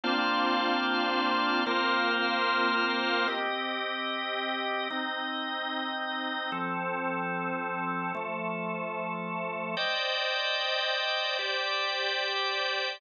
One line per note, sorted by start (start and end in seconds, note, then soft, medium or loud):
0.03 1.64 A#3 medium
0.03 1.64 C4 medium
0.03 1.64 D4 medium
0.03 1.64 F4 medium
0.03 1.64 C5 medium
0.03 1.64 D5 medium
0.03 1.64 F5 medium
1.66 3.27 A#3 medium
1.66 3.27 C4 medium
1.66 3.27 F4 medium
1.66 3.27 A#4 medium
1.66 3.27 C5 medium
1.66 3.27 F5 medium
3.27 4.88 C4 medium
3.27 4.88 G4 medium
3.27 4.88 D#5 medium
4.90 6.51 C4 medium
4.90 6.51 D#4 medium
4.90 6.51 D#5 medium
6.52 8.12 F3 medium
6.52 8.12 C4 medium
6.52 8.12 A4 medium
8.15 9.75 F3 medium
8.15 9.75 A3 medium
8.15 9.75 A4 medium
9.77 11.37 C5 medium
9.77 11.37 D5 medium
9.77 11.37 D#5 medium
9.77 11.37 G5 medium
11.39 12.99 G4 medium
11.39 12.99 C5 medium
11.39 12.99 D5 medium
11.39 12.99 G5 medium